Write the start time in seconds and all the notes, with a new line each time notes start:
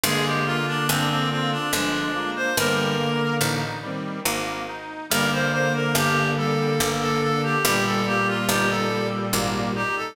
0.04 G1 D3 G#3 A#3 G#4
0.25 G4
0.46 A#3 F4
0.67 D4
0.88 G1 C4 D4
1.10 C4
1.30 C4 F4
1.52 D4
1.72 G1 F3 G#3 D4
2.15 G#3 A#3 F4
2.36 C5
2.57 G1 D3 G3 A#3 A#4
2.99 A#3
3.41 A1 D#4
3.82 D#3 G3 C4
4.25 G#1 A#3
4.68 D#4
5.10 G1 D3 G3 A#3 A#4
5.32 C5
5.52 A#3 C5
5.75 A#4
5.95 G1 D4 G4
6.37 G3 A4
6.80 G1 A#3
7.01 A4
7.21 D4 A4
7.43 G4
7.64 G1 A#2 G3 G4
7.86 A4
8.06 A#3 G4
8.27 F4
8.48 G1 D#4 G4
8.70 A4
8.89 G3
9.33 G#1 A#3
9.75 D#4 G4
9.97 A4